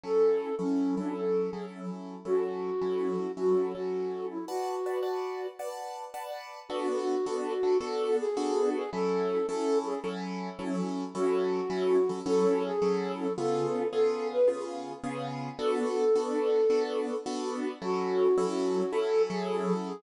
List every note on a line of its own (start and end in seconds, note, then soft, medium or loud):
0.03 0.49 F#3 medium
0.03 0.49 C#4 medium
0.03 0.49 E4 medium
0.03 0.49 A4 medium
0.03 0.55 A4 loud
0.59 0.95 F#3 medium
0.59 0.95 C#4 medium
0.59 0.95 E4 medium
0.59 0.95 A4 medium
0.97 1.49 F#3 medium
0.97 1.49 C#4 medium
0.97 1.14 D4 medium
0.97 1.49 E4 medium
0.97 1.49 A4 medium
1.16 1.51 A4 medium
1.50 2.15 F#3 medium
1.50 2.15 C#4 medium
1.50 2.15 E4 medium
1.50 1.66 G#4 medium
1.50 2.15 A4 medium
2.25 2.70 F#3 medium
2.25 2.70 C#4 medium
2.25 2.70 E4 medium
2.25 3.32 F#4 medium
2.25 2.70 A4 medium
2.81 3.27 F#3 medium
2.81 3.27 C#4 medium
2.81 3.27 E4 medium
2.81 3.27 A4 medium
3.37 3.73 F#3 medium
3.37 3.73 C#4 medium
3.37 3.73 E4 medium
3.37 3.73 F#4 medium
3.37 3.73 A4 medium
3.74 4.37 F#3 medium
3.74 4.37 C#4 medium
3.74 4.37 E4 medium
3.74 4.27 F#4 medium
3.74 4.37 A4 medium
4.30 4.45 E4 medium
4.48 5.47 F#4 medium
4.48 4.75 B4 medium
4.48 4.75 D5 medium
4.48 4.75 F#5 medium
4.48 4.75 A5 medium
4.86 4.98 B4 medium
4.86 4.98 D5 medium
4.86 4.98 F#5 medium
4.86 4.98 A5 medium
5.03 5.48 B4 medium
5.03 5.48 D5 medium
5.03 5.48 F#5 medium
5.03 5.48 A5 medium
5.59 6.04 B4 medium
5.59 6.04 D5 medium
5.59 6.04 F#5 medium
5.59 6.04 A5 medium
6.14 6.59 B4 medium
6.14 6.59 D5 medium
6.14 6.59 F#5 medium
6.14 6.59 A5 medium
6.69 7.15 B3 loud
6.69 7.15 D4 loud
6.69 7.78 F#4 loud
6.69 7.15 F#4 loud
6.69 7.15 A4 loud
7.26 7.53 B3 loud
7.26 7.53 D4 loud
7.26 7.53 F#4 loud
7.26 7.53 A4 loud
7.63 7.75 B3 medium
7.63 7.75 D4 loud
7.63 7.75 F#4 medium
7.63 7.75 A4 medium
7.80 8.26 B3 loud
7.80 8.26 D4 loud
7.80 8.26 F#4 loud
7.80 8.26 A4 loud
7.80 8.17 A4 loud
8.20 8.69 G#4 loud
8.37 8.82 B3 loud
8.37 8.82 D4 loud
8.37 8.82 F#4 loud
8.37 8.82 A4 loud
8.75 8.90 G#4 medium
8.93 9.38 F#3 loud
8.93 9.38 C#4 loud
8.93 9.38 E4 loud
8.93 9.38 A4 medium
8.93 9.47 A4 loud
9.47 9.94 F#3 medium
9.47 9.94 C#4 loud
9.47 9.94 E4 loud
9.47 9.78 A4 medium
9.47 9.94 A4 loud
9.86 10.00 G#4 medium
10.04 10.49 F#3 loud
10.04 10.49 C#4 loud
10.04 10.49 E4 loud
10.04 10.49 A4 loud
10.59 11.04 F#3 loud
10.59 11.04 C#4 loud
10.59 11.04 E4 loud
10.59 11.04 A4 loud
11.15 11.60 F#3 loud
11.15 11.60 C#4 loud
11.15 11.60 E4 loud
11.15 12.19 F#4 loud
11.15 11.60 A4 loud
11.70 11.97 F#3 loud
11.70 11.97 C#4 loud
11.70 11.97 E4 loud
11.70 11.97 A4 loud
12.09 12.21 F#3 medium
12.09 12.21 C#4 medium
12.09 12.21 E4 medium
12.09 12.21 A4 loud
12.26 12.71 F#3 loud
12.26 12.71 C#4 loud
12.26 12.71 E4 loud
12.26 12.63 A4 loud
12.26 12.71 A4 loud
12.65 13.13 G#4 loud
12.82 13.27 F#3 loud
12.82 13.27 C#4 loud
12.82 13.27 E4 loud
12.82 13.27 A4 loud
13.19 13.33 A4 medium
13.38 13.83 C#3 loud
13.38 13.83 B3 loud
13.38 13.83 F4 loud
13.38 13.83 G#4 medium
13.38 13.88 A4 medium
13.92 14.38 C#3 loud
13.92 14.38 B3 loud
13.92 14.38 F4 loud
13.92 14.38 G#4 loud
13.92 14.28 A4 medium
14.32 14.48 B4 medium
14.48 14.93 C#3 loud
14.48 14.93 B3 loud
14.48 14.93 F4 loud
14.48 14.93 G#4 loud
15.04 15.49 C#3 loud
15.04 15.49 B3 loud
15.04 15.49 F4 loud
15.04 15.49 G#4 loud
15.59 16.04 B3 loud
15.59 16.04 D4 loud
15.59 16.04 F#4 loud
15.59 16.04 A4 loud
15.59 16.83 A4 medium
16.16 16.61 B3 loud
16.16 16.61 D4 loud
16.16 16.61 F#4 loud
16.16 16.61 A4 loud
16.70 17.15 B3 loud
16.70 17.15 D4 loud
16.70 17.15 F#4 loud
16.70 17.15 A4 loud
17.26 17.71 B3 loud
17.26 17.71 D4 loud
17.26 17.71 F#4 loud
17.26 17.71 A4 loud
17.82 18.27 F#3 loud
17.82 18.27 C#4 loud
17.82 18.27 E4 loud
17.82 18.92 F#4 loud
17.82 18.27 A4 loud
18.38 18.83 F#3 loud
18.38 18.83 C#4 loud
18.38 18.83 E4 loud
18.38 18.83 A4 loud
18.92 19.29 F#3 loud
18.92 19.29 C#4 loud
18.92 19.29 E4 loud
18.92 19.22 A4 medium
18.92 19.29 A4 loud
19.30 19.92 F#3 loud
19.30 19.92 C#4 loud
19.30 19.92 E4 loud
19.30 19.74 G#4 medium
19.30 19.92 A4 loud
19.87 20.01 G#4 medium